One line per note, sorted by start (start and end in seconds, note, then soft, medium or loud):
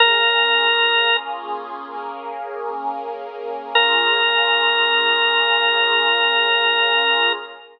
0.00 1.86 A#3 medium
0.00 1.86 C#4 medium
0.00 1.86 F4 medium
0.00 1.86 G#4 loud
0.00 1.17 A#4 loud
1.87 3.73 A#3 medium
1.87 3.73 C#4 medium
1.87 3.73 G#4 medium
1.87 3.73 A#4 medium
3.75 7.32 A#3 medium
3.75 7.32 C#4 loud
3.75 7.32 F4 loud
3.75 7.32 G#4 loud
3.75 7.33 A#4 loud